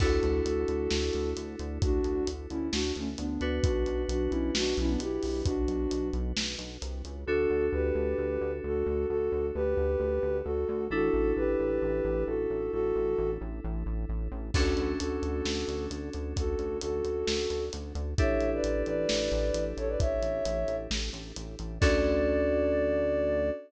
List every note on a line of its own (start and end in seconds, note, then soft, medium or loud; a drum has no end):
0.00 0.20 D2 loud
0.00 3.24 D4 medium
0.00 3.24 E4 medium
0.00 3.24 F#4 medium
0.00 0.40 F#4 medium
0.00 3.24 A4 medium
0.00 0.40 A4 medium
0.00 kick loud
0.00 crash medium
0.23 0.42 D2 medium
0.23 closed hi-hat medium
0.45 0.65 D2 medium
0.45 1.30 F#4 medium
0.45 1.30 A4 medium
0.45 closed hi-hat medium
0.68 0.88 D2 medium
0.68 closed hi-hat medium
0.91 1.10 D2 medium
0.91 snare medium
1.13 1.34 D2 medium
1.13 closed hi-hat medium
1.36 1.56 D2 medium
1.36 closed hi-hat medium
1.59 1.79 D2 medium
1.59 closed hi-hat medium
1.82 2.01 D2 medium
1.82 2.27 D4 medium
1.82 2.27 F#4 medium
1.82 kick loud
1.82 closed hi-hat loud
2.04 2.24 D2 medium
2.04 closed hi-hat medium
2.27 2.47 D2 medium
2.27 closed hi-hat loud
2.50 2.70 D2 medium
2.50 2.68 C#4 medium
2.50 2.68 E4 medium
2.50 closed hi-hat medium
2.72 2.92 D2 medium
2.72 2.92 D4 medium
2.72 2.92 F#4 medium
2.72 snare loud
2.95 3.15 D2 medium
2.95 3.08 A3 medium
2.95 3.08 C#4 medium
2.95 closed hi-hat medium
3.17 3.38 D2 medium
3.17 3.59 B3 medium
3.17 3.59 D4 medium
3.17 closed hi-hat medium
3.41 3.60 D2 medium
3.41 7.20 D4 medium
3.41 7.20 F#4 medium
3.41 7.20 B4 medium
3.41 closed hi-hat medium
3.63 3.84 B1 loud
3.63 4.03 D4 medium
3.63 4.03 F#4 medium
3.63 kick loud
3.63 closed hi-hat loud
3.86 4.05 B1 medium
3.86 closed hi-hat medium
4.09 4.28 B1 medium
4.09 4.31 D4 medium
4.09 4.31 F#4 medium
4.09 closed hi-hat medium
4.30 4.51 B1 medium
4.30 4.51 C#4 medium
4.30 4.51 E4 medium
4.30 closed hi-hat medium
4.55 4.74 B1 loud
4.55 4.77 D4 medium
4.55 4.77 F#4 medium
4.55 snare loud
4.77 4.97 B1 loud
4.77 4.89 C#4 medium
4.77 4.89 E4 medium
4.77 closed hi-hat medium
4.88 4.99 B3 medium
4.88 4.99 D4 medium
4.99 5.19 B1 medium
4.99 5.41 E4 medium
4.99 5.41 G4 medium
4.99 closed hi-hat loud
5.23 5.42 B1 medium
5.23 open hi-hat medium
5.45 5.65 B1 medium
5.45 6.08 D4 medium
5.45 6.08 F#4 medium
5.45 kick medium
5.45 closed hi-hat loud
5.68 5.87 B1 medium
5.68 closed hi-hat medium
5.91 6.11 B1 medium
5.91 closed hi-hat medium
6.13 6.33 B1 medium
6.13 closed hi-hat medium
6.37 6.56 B1 medium
6.37 snare loud
6.58 6.78 B1 medium
6.58 closed hi-hat medium
6.82 7.02 C2 medium
6.82 closed hi-hat medium
7.04 7.25 C#2 medium
7.04 closed hi-hat medium
7.26 7.46 D2 loud
7.26 10.84 D4 medium
7.26 7.66 F#4 medium
7.26 10.84 F#4 medium
7.26 7.66 A4 medium
7.26 10.84 A4 medium
7.50 7.69 D2 medium
7.72 7.92 D2 medium
7.72 8.51 G4 medium
7.72 8.51 B4 medium
7.95 8.14 D2 medium
8.18 8.38 D2 medium
8.41 8.60 D2 medium
8.64 8.83 D2 medium
8.64 9.06 F#4 medium
8.64 9.06 A4 medium
8.86 9.06 D2 medium
9.09 9.29 D2 medium
9.09 9.46 F#4 medium
9.09 9.46 A4 medium
9.32 9.51 D2 medium
9.54 9.75 D2 medium
9.54 10.37 G4 medium
9.54 10.37 B4 medium
9.77 9.96 D2 medium
10.00 10.19 D2 medium
10.23 10.42 D2 medium
10.44 10.65 D2 medium
10.44 10.85 F#4 medium
10.44 10.85 A4 medium
10.69 10.88 D2 loud
10.90 11.10 A1 loud
10.90 14.47 D4 medium
10.90 14.47 E4 medium
10.90 11.33 F#4 medium
10.90 14.47 A4 medium
10.90 11.33 A4 medium
11.13 11.33 A1 medium
11.36 11.56 A1 medium
11.36 12.24 G4 medium
11.36 12.24 B4 medium
11.60 11.79 A1 medium
11.82 12.01 A1 medium
12.04 12.24 A1 loud
12.27 12.47 A1 medium
12.27 12.71 F#4 medium
12.27 12.71 A4 medium
12.50 12.70 A1 medium
12.72 12.92 A1 medium
12.72 13.30 F#4 medium
12.72 13.30 A4 medium
12.95 13.15 A1 medium
13.18 13.38 A1 loud
13.41 13.60 A1 loud
13.64 13.84 A1 loud
13.86 14.05 A1 medium
14.09 14.28 A1 medium
14.31 14.51 A1 loud
14.54 14.74 D2 loud
14.54 18.11 C#4 medium
14.54 18.11 D4 medium
14.54 18.11 F#4 medium
14.54 14.92 F#4 medium
14.54 18.11 A4 medium
14.54 14.92 A4 medium
14.54 kick loud
14.54 crash loud
14.77 14.96 D2 medium
14.77 closed hi-hat medium
14.98 15.20 D2 medium
14.98 15.85 F#4 medium
14.98 15.85 A4 medium
14.98 closed hi-hat loud
15.22 15.42 D2 medium
15.22 closed hi-hat medium
15.45 15.64 D2 medium
15.45 snare medium
15.68 15.87 D2 medium
15.68 closed hi-hat medium
15.90 16.10 D2 medium
15.90 closed hi-hat medium
16.13 16.34 D2 medium
16.13 closed hi-hat medium
16.36 16.56 D2 medium
16.36 16.77 F#4 medium
16.36 16.77 A4 medium
16.36 kick medium
16.36 closed hi-hat loud
16.59 16.78 D2 medium
16.59 closed hi-hat medium
16.81 17.02 D2 medium
16.81 17.64 F#4 medium
16.81 17.64 A4 medium
16.81 closed hi-hat loud
17.05 17.24 D2 medium
17.05 closed hi-hat medium
17.27 17.47 D2 medium
17.27 snare loud
17.50 17.69 D2 medium
17.50 closed hi-hat medium
17.73 17.93 D2 medium
17.73 closed hi-hat loud
17.95 18.14 D2 medium
17.95 closed hi-hat medium
18.18 18.37 A1 medium
18.18 21.75 D4 medium
18.18 21.75 E4 medium
18.18 21.75 G4 medium
18.18 21.75 A4 medium
18.18 18.50 C#5 medium
18.18 18.50 E5 medium
18.18 kick loud
18.18 closed hi-hat loud
18.40 18.60 A1 medium
18.40 closed hi-hat medium
18.54 18.83 B4 medium
18.54 18.83 D5 medium
18.64 18.83 A1 medium
18.64 closed hi-hat medium
18.86 19.06 A1 medium
18.86 19.64 B4 medium
18.86 19.64 D5 medium
18.86 closed hi-hat medium
19.09 19.29 A1 medium
19.09 snare loud
19.32 19.51 A1 medium
19.32 closed hi-hat medium
19.54 19.73 A1 medium
19.54 closed hi-hat loud
19.77 19.96 A1 medium
19.77 19.88 A4 medium
19.77 19.88 C#5 medium
19.77 closed hi-hat medium
19.88 19.99 B4 medium
19.88 19.99 D5 medium
20.00 20.19 A1 medium
20.00 20.76 C#5 medium
20.00 20.76 E5 medium
20.00 kick medium
20.00 closed hi-hat medium
20.22 20.41 A1 medium
20.22 closed hi-hat medium
20.45 20.65 A1 medium
20.45 closed hi-hat loud
20.68 20.87 A1 medium
20.68 closed hi-hat medium
20.91 21.10 A1 medium
20.91 snare loud
21.13 21.32 A1 medium
21.13 closed hi-hat medium
21.36 21.56 A1 medium
21.36 closed hi-hat loud
21.59 21.79 A1 medium
21.59 closed hi-hat medium
21.80 23.51 D2 loud
21.80 23.50 C#4 medium
21.80 23.50 D4 loud
21.80 23.50 F#4 loud
21.80 23.50 A4 loud
21.80 23.49 D5 loud
21.80 kick loud
21.80 crash loud